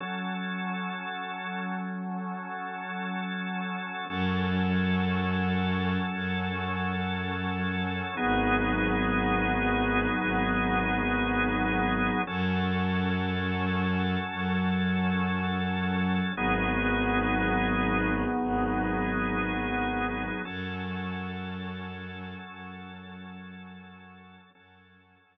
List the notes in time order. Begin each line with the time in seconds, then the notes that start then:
0.00 F#3 C#4 A4
4.09 F#2 F#3 C#4 A4
6.13 F#2
8.17 G#1 F#3 B3 D#4 G#4
10.21 G#1
12.27 F#2 F#3 C#4 A4
14.32 F#2
16.36 G#1 F#3 B3 D#4 G#4
18.42 G#1
20.45 F#2 F#3 C#4 A4
22.49 F#2
24.55 F#2 F#3 C#4 A4
25.24 F#2